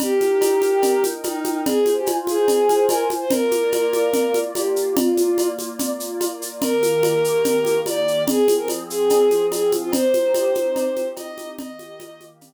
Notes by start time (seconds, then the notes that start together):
0.00 D#4 G4 A#4 G5, cowbell, low conga, shaker
0.21 high conga, shaker
0.41 cowbell, high conga, shaker
0.62 high conga, shaker
0.82 cowbell, low conga, shaker
1.04 high conga, shaker
1.24 D#4, cowbell, high conga, shaker
1.44 high conga, shaker
1.65 F4 G#4 C5 G#5, cowbell, low conga, shaker
1.86 high conga, shaker
1.96 G4
2.06 cowbell, high conga, shaker
2.27 G#4, high conga, shaker
2.48 cowbell, low conga, shaker
2.69 high conga, shaker
2.88 A#4, cowbell, high conga, shaker
3.10 high conga, shaker
3.21 C5
3.31 A#3 F4 A#4 D5, cowbell, low conga, shaker
3.51 high conga, shaker
3.72 cowbell, high conga, shaker
3.93 high conga, shaker
4.13 cowbell, low conga, shaker
4.34 high conga, shaker
4.55 G4, cowbell, high conga, shaker
4.76 shaker
4.96 A#3 F4 D5, cowbell, low conga, shaker
5.17 high conga, shaker
5.38 cowbell, high conga, shaker
5.59 high conga, shaker
5.79 cowbell, low conga, shaker
6.00 shaker
6.21 cowbell, high conga, shaker
6.42 shaker
6.62 D#3 A#3 G4 A#4, cowbell, low conga, shaker
6.83 high conga, shaker
7.03 cowbell, high conga, shaker
7.24 shaker
7.44 cowbell, low conga, shaker
7.65 high conga, shaker
7.86 D5, cowbell, high conga, shaker
8.08 shaker
8.27 F3 C4 G#4, cowbell, low conga, shaker
8.48 high conga, shaker
8.58 A#4
8.68 cowbell, high conga, shaker
8.90 G#4, shaker
9.10 cowbell, low conga, shaker
9.31 high conga, shaker
9.52 G#4, cowbell, high conga, shaker
9.72 high conga, shaker
9.82 F4
9.92 C4 D#4 G4 C5, cowbell, low conga, shaker
10.14 high conga, shaker
10.34 cowbell, high conga, shaker
10.55 high conga, shaker
10.76 cowbell, low conga, shaker
10.96 high conga, shaker
11.16 D#5, cowbell, high conga, shaker
11.38 high conga, shaker
11.59 D#3 A#3 G4 D#5, cowbell, low conga, shaker
11.79 high conga, shaker
12.00 cowbell, high conga, shaker
12.20 high conga, shaker
12.41 cowbell, low conga, shaker